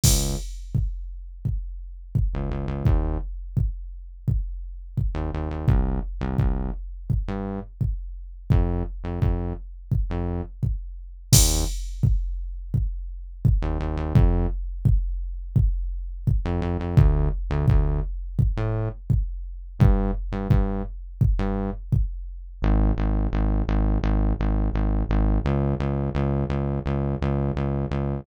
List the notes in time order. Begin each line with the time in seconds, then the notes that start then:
0.04 C#2, kick, crash
0.75 kick
1.45 kick
2.15 kick
2.34 C#2
2.51 C#2
2.68 C#2
2.85 D#2, kick
3.57 kick
4.28 kick
4.97 kick
5.15 D#2
5.34 D#2
5.51 D#2
5.68 C2, kick
6.21 C2
6.38 C2, kick
7.10 kick
7.28 G2
7.81 kick
8.50 F2, kick
9.04 F2
9.21 F2, kick
9.92 kick
10.10 F2
10.63 kick
11.33 D#2, kick, crash
12.03 kick
12.74 kick
13.45 kick
13.62 D#2
13.80 D#2
13.97 D#2
14.15 F2, kick
14.85 kick
15.56 kick
16.27 kick
16.45 F2
16.62 F2
16.80 F2
16.97 D2, kick
17.50 D2
17.68 D2, kick
18.39 kick
18.57 A2
19.10 kick
19.79 G2, kick
20.32 G2
20.50 G2, kick
21.21 kick
21.39 G2
21.92 kick
22.62 G#1
22.98 G#1
23.33 G#1
23.68 G#1
24.04 G#1
24.39 G#1
24.74 G#1
25.09 G#1
25.45 C#2
25.80 C#2
26.15 C#2
26.50 C#2
26.86 C#2
27.21 C#2
27.56 C#2
27.91 C#2